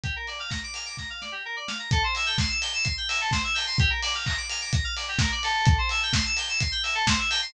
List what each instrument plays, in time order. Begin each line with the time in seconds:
0.04 electric piano 2 G4, kick, closed hi-hat
0.16 electric piano 2 A#4
0.27 electric piano 2 D5, open hi-hat
0.40 electric piano 2 F5
0.50 electric piano 2 A#5, kick, snare
0.64 electric piano 2 D6
0.74 electric piano 2 F6, open hi-hat
0.86 electric piano 2 D6
0.97 electric piano 2 A#5, kick, snare
1.10 electric piano 2 F5
1.21 electric piano 2 D5, snare
1.32 electric piano 2 G4
1.45 electric piano 2 A#4
1.56 electric piano 2 D5
1.68 electric piano 2 F5, snare
1.79 electric piano 2 A#5
1.91 electric piano 2 A4, kick, closed hi-hat
2.03 electric piano 2 C5
2.15 electric piano 2 E5, open hi-hat
2.26 electric piano 2 G5
2.38 electric piano 2 C6, kick, snare
2.49 electric piano 2 E6
2.61 electric piano 2 G6, open hi-hat
2.73 electric piano 2 E6
2.84 electric piano 2 C6, kick, closed hi-hat
2.97 electric piano 2 G5
3.09 electric piano 2 E5, open hi-hat
3.21 electric piano 2 A4
3.31 electric piano 2 C5, kick, snare
3.44 electric piano 2 E5
3.54 electric piano 2 G5, open hi-hat
3.67 electric piano 2 C6
3.78 electric piano 2 G4, kick, closed hi-hat
3.90 electric piano 2 A#4
4.02 electric piano 2 D5, open hi-hat
4.15 electric piano 2 F5
4.26 electric piano 2 A#5, kick, clap
4.37 electric piano 2 D6
4.49 electric piano 2 F6, open hi-hat
4.61 electric piano 2 D6
4.73 electric piano 2 A#5, kick, closed hi-hat
4.84 electric piano 2 F5
4.96 electric piano 2 D5, open hi-hat
5.08 electric piano 2 G4
5.19 electric piano 2 A#4, kick, snare
5.32 electric piano 2 D5
5.43 electric piano 2 A4, open hi-hat
5.65 kick, closed hi-hat
5.78 electric piano 2 C5
5.89 electric piano 2 E5, open hi-hat
6.03 electric piano 2 G5
6.13 electric piano 2 C6, kick, snare
6.26 electric piano 2 E6
6.37 electric piano 2 G6, open hi-hat
6.49 electric piano 2 E6
6.60 electric piano 2 C6, kick, closed hi-hat
6.72 electric piano 2 G5
6.83 electric piano 2 E5, open hi-hat
6.95 electric piano 2 A4
7.07 electric piano 2 C5, kick, snare
7.19 electric piano 2 E5
7.30 electric piano 2 G5, open hi-hat
7.42 electric piano 2 C6